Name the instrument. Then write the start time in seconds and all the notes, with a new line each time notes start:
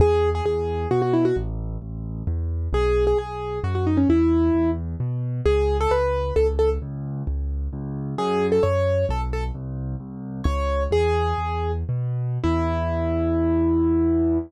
acoustic grand piano
0.00 E2 G#4
0.35 G#4
0.45 E2 G#4
0.91 B2 F#4
1.02 F#4
1.13 E4
1.25 F#4
1.36 A1
1.82 A1
2.27 E2
2.73 B1 G#4
3.07 G#4
3.18 B1 G#4
3.64 F#2 F#4
3.75 F#4
3.87 D#4
3.97 C#4
4.09 E2 E4
4.55 E2
5.00 B2
5.45 C#2 G#4
5.81 A4
5.91 C#2 B4
6.36 C#2 A4
6.59 A4
6.82 C#2
7.27 C#2
7.73 C#2
8.18 F#2 G#4
8.52 A4
8.63 F#2 C#5
9.09 B1 A4
9.33 A4
9.55 C2
10.00 C2
10.44 C#2 C#5
10.91 E2 G#4
11.38 E2
11.89 B2
12.44 E2 E4